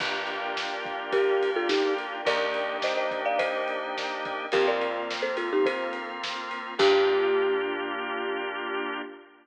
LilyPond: <<
  \new Staff \with { instrumentName = "Marimba" } { \time 4/4 \key g \minor \tempo 4 = 106 r2 <g' bes'>8. <f' a'>16 <ees' g'>8 r8 | <bes' d''>4 <c'' ees''>16 <c'' ees''>8 <d'' f''>16 <c'' ees''>2 | <g' bes'>16 <bes' d''>4 <a' c''>16 <f' a'>16 <ees' g'>16 <a' c''>8 r4. | g'1 | }
  \new Staff \with { instrumentName = "Drawbar Organ" } { \time 4/4 \key g \minor <bes d' f' g'>1 | <bes d' ees' g'>1 | <bes c' f'>1 | <bes d' f' g'>1 | }
  \new Staff \with { instrumentName = "Electric Bass (finger)" } { \clef bass \time 4/4 \key g \minor g,,1 | ees,1 | f,1 | g,1 | }
  \new Staff \with { instrumentName = "Pad 2 (warm)" } { \time 4/4 \key g \minor <bes' d'' f'' g''>1 | <bes' d'' ees'' g''>1 | <bes c' f'>1 | <bes d' f' g'>1 | }
  \new DrumStaff \with { instrumentName = "Drums" } \drummode { \time 4/4 <cymc bd>8 cymr8 sn8 <bd cymr>8 <bd cymr>8 cymr8 sn8 cymr8 | <bd cymr>8 cymr8 sn8 <bd cymr>8 <bd cymr>8 cymr8 sn8 <bd cymr>8 | <bd cymr>8 cymr8 sn8 cymr8 <bd cymr>8 cymr8 sn8 cymr8 | <cymc bd>4 r4 r4 r4 | }
>>